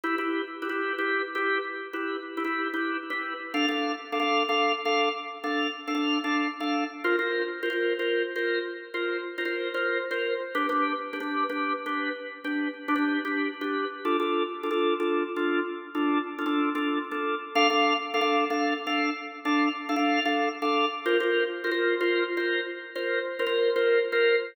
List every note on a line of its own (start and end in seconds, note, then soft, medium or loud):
0.04 0.15 E4 medium
0.04 0.15 G4 medium
0.04 0.15 B4 medium
0.18 0.42 E4 medium
0.18 0.42 G4 medium
0.18 0.42 B4 medium
0.62 0.68 E4 medium
0.62 0.68 G4 medium
0.62 0.68 B4 medium
0.69 0.93 E4 medium
0.69 0.93 G4 medium
0.69 0.93 B4 medium
0.98 1.22 E4 medium
0.98 1.22 G4 medium
0.98 1.22 B4 medium
1.35 1.58 E4 medium
1.35 1.58 G4 medium
1.35 1.58 B4 medium
1.93 2.17 E4 medium
1.93 2.17 G4 medium
1.93 2.17 B4 medium
2.37 2.43 E4 medium
2.37 2.43 G4 medium
2.37 2.43 B4 medium
2.44 2.68 E4 medium
2.44 2.68 G4 medium
2.44 2.68 B4 medium
2.74 2.97 E4 medium
2.74 2.97 G4 medium
2.74 2.97 B4 medium
3.10 3.33 E4 medium
3.10 3.33 G4 medium
3.10 3.33 B4 medium
3.54 3.66 D4 loud
3.54 3.66 A4 medium
3.54 3.66 F5 loud
3.68 3.92 D4 medium
3.68 3.92 A4 medium
3.68 3.92 F5 medium
4.12 4.18 D4 medium
4.12 4.18 A4 medium
4.12 4.18 F5 medium
4.20 4.43 D4 medium
4.20 4.43 A4 medium
4.20 4.43 F5 medium
4.49 4.72 D4 medium
4.49 4.72 A4 medium
4.49 4.72 F5 medium
4.85 5.09 D4 medium
4.85 5.09 A4 medium
4.85 5.09 F5 medium
5.44 5.67 D4 medium
5.44 5.67 A4 medium
5.44 5.67 F5 medium
5.88 5.93 D4 medium
5.88 5.93 A4 medium
5.88 5.93 F5 medium
5.95 6.18 D4 medium
5.95 6.18 A4 medium
5.95 6.18 F5 medium
6.24 6.47 D4 medium
6.24 6.47 A4 medium
6.24 6.47 F5 medium
6.60 6.84 D4 medium
6.60 6.84 A4 medium
6.60 6.84 F5 medium
7.04 7.16 F4 loud
7.04 7.16 A#4 medium
7.04 7.16 C5 medium
7.19 7.42 F4 medium
7.19 7.42 A#4 medium
7.19 7.42 C5 medium
7.63 7.69 F4 medium
7.63 7.69 A#4 medium
7.63 7.69 C5 medium
7.70 7.93 F4 medium
7.70 7.93 A#4 medium
7.70 7.93 C5 medium
7.99 8.23 F4 medium
7.99 8.23 A#4 medium
7.99 8.23 C5 medium
8.36 8.59 F4 medium
8.36 8.59 A#4 medium
8.36 8.59 C5 medium
8.94 9.17 F4 medium
8.94 9.17 A#4 medium
8.94 9.17 C5 medium
9.38 9.44 F4 medium
9.38 9.44 A#4 medium
9.38 9.44 C5 medium
9.45 9.69 F4 medium
9.45 9.69 A#4 medium
9.45 9.69 C5 medium
9.74 9.98 F4 medium
9.74 9.98 A#4 medium
9.74 9.98 C5 medium
10.11 10.34 F4 medium
10.11 10.34 A#4 medium
10.11 10.34 C5 medium
10.55 10.66 D4 medium
10.55 10.66 G4 medium
10.55 10.66 B4 loud
10.69 10.93 D4 medium
10.69 10.93 G4 medium
10.69 10.93 B4 medium
11.13 11.19 D4 medium
11.13 11.19 G4 medium
11.13 11.19 B4 medium
11.20 11.44 D4 medium
11.20 11.44 G4 medium
11.20 11.44 B4 medium
11.49 11.73 D4 medium
11.49 11.73 G4 medium
11.49 11.73 B4 medium
11.86 12.09 D4 medium
11.86 12.09 G4 medium
11.86 12.09 B4 medium
12.44 12.68 D4 medium
12.44 12.68 G4 medium
12.44 12.68 B4 medium
12.88 12.94 D4 medium
12.88 12.94 G4 medium
12.88 12.94 B4 medium
12.96 13.19 D4 medium
12.96 13.19 G4 medium
12.96 13.19 B4 medium
13.25 13.48 D4 medium
13.25 13.48 G4 medium
13.25 13.48 B4 medium
13.61 13.85 D4 medium
13.61 13.85 G4 medium
13.61 13.85 B4 medium
14.05 14.17 D4 medium
14.05 14.17 F4 medium
14.05 14.17 A4 medium
14.20 14.43 D4 medium
14.20 14.43 F4 medium
14.20 14.43 A4 medium
14.63 14.69 D4 medium
14.63 14.69 F4 medium
14.63 14.69 A4 medium
14.71 14.94 D4 medium
14.71 14.94 F4 medium
14.71 14.94 A4 medium
15.00 15.23 D4 medium
15.00 15.23 F4 medium
15.00 15.23 A4 medium
15.36 15.60 D4 medium
15.36 15.60 F4 medium
15.36 15.60 A4 medium
15.95 16.18 D4 medium
15.95 16.18 F4 medium
15.95 16.18 A4 medium
16.39 16.44 D4 medium
16.39 16.44 F4 medium
16.39 16.44 A4 medium
16.46 16.69 D4 medium
16.46 16.69 F4 medium
16.46 16.69 A4 medium
16.75 16.98 D4 medium
16.75 16.98 F4 medium
16.75 16.98 A4 medium
17.11 17.35 D4 medium
17.11 17.35 F4 medium
17.11 17.35 A4 medium
17.55 17.67 D4 loud
17.55 17.67 A4 medium
17.55 17.67 F5 loud
17.70 17.93 D4 medium
17.70 17.93 A4 medium
17.70 17.93 F5 medium
18.14 18.20 D4 medium
18.14 18.20 A4 medium
18.14 18.20 F5 medium
18.21 18.44 D4 medium
18.21 18.44 A4 medium
18.21 18.44 F5 medium
18.50 18.74 D4 medium
18.50 18.74 A4 medium
18.50 18.74 F5 medium
18.87 19.10 D4 medium
18.87 19.10 A4 medium
18.87 19.10 F5 medium
19.45 19.68 D4 medium
19.45 19.68 A4 medium
19.45 19.68 F5 medium
19.89 19.95 D4 medium
19.89 19.95 A4 medium
19.89 19.95 F5 medium
19.96 20.20 D4 medium
19.96 20.20 A4 medium
19.96 20.20 F5 medium
20.25 20.49 D4 medium
20.25 20.49 A4 medium
20.25 20.49 F5 medium
20.62 20.85 D4 medium
20.62 20.85 A4 medium
20.62 20.85 F5 medium
21.06 21.17 F4 loud
21.06 21.17 A#4 loud
21.06 21.17 C5 loud
21.20 21.44 F4 medium
21.20 21.44 A#4 medium
21.20 21.44 C5 medium
21.64 21.70 F4 loud
21.64 21.70 A#4 medium
21.64 21.70 C5 medium
21.71 21.95 F4 medium
21.71 21.95 A#4 medium
21.71 21.95 C5 medium
22.01 22.24 F4 medium
22.01 22.24 A#4 medium
22.01 22.24 C5 medium
22.37 22.60 F4 medium
22.37 22.60 A#4 medium
22.37 22.60 C5 medium
22.96 23.19 F4 medium
22.96 23.19 A#4 medium
22.96 23.19 C5 medium
23.39 23.45 F4 medium
23.39 23.45 A#4 medium
23.39 23.45 C5 medium
23.46 23.70 F4 medium
23.46 23.70 A#4 medium
23.46 23.70 C5 medium
23.76 23.99 F4 medium
23.76 23.99 A#4 medium
23.76 23.99 C5 medium
24.12 24.36 F4 medium
24.12 24.36 A#4 medium
24.12 24.36 C5 loud